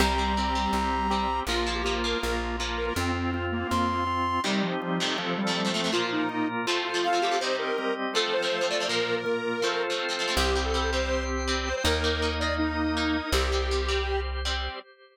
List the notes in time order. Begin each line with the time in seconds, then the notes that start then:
0.00 C2 G3 C4 G4 A#5
0.18 G3 C4
0.37 G3 C4 G4
0.55 G3 C4
0.73 C2 C4 G4
1.10 G3 C4 G4
1.47 A#1 F3 A#3 F4
1.67 F3 A#3
1.75 G4
1.84 F3 A#3 F4
2.04 F3 A#3 A#4
2.23 A#1 A#3 F4
2.60 F3 A#3 F4
2.77 A#4
2.87 A#4
2.96 F2 C4 F4
3.15 C4
3.34 C4 F4
3.52 A#3
3.71 F2 C4 F4 C6
4.07 C4 F4
4.44 C3 D#3 G3 C4 D#4 G4
4.62 F3
4.82 G3 C4 G4
5.00 F2 C3 A3
5.18 F3 C4 A4
5.38 G3
5.47 F2 C3 A3
5.55 F3 A3 A4
5.65 F2 C3 A3
5.74 F2 C3 A3
5.84 F2 C3 A3
5.92 A#2 F3 A#3 F4 A#4
6.12 D#4
6.29 A#2 A#3 A#4
6.67 F3 A3 C4 F4 A4 C5
6.85 F4
6.94 F3 A3 C4
7.04 C4 F4 C5 F5
7.13 F3 A3 C4
7.22 F3 A3 C4 G4
7.31 F3 A3 C4
7.40 C3 G3 C4 D#4 G4 C5 D#5
7.59 A#4
7.78 G3 C4 G4
8.14 F3 A3 C4 F4 A4 C5
8.33 C5
8.43 F3 A3 C4
8.51 F3 A3 A4
8.61 F3 A3 C4
8.70 F3 A3 C4 D5
8.80 F3 A3 C4
8.88 A#2 F3 A#3 F4 A#4
9.16 A#4
9.26 A#2 A#3 A#4
9.62 F3 A3 C4 F4 A4 C5
9.90 F3 A3 C4
10.00 C4 F4 C5
10.09 F3 A3 C4
10.19 F3 A3 C4
10.28 F3 A3 C4
10.36 C2 G3 C4 G4 C5 G5
10.55 G3 C4
10.65 A4
10.74 G3 C4
10.92 G3 C4 C5
11.48 G3 C4
11.66 C5
11.76 C5
11.84 D#2 A#3 D#4 A#4 D#5
12.04 A#3 D#4
12.22 A#3 D#4
12.40 A#3 D#4 D5
12.58 D#4
12.97 A#3 D#4
13.32 C2 G3 C4 G4 C5
13.52 G3 C4
13.71 G3 C4
13.89 G3 C4
14.45 G3 C4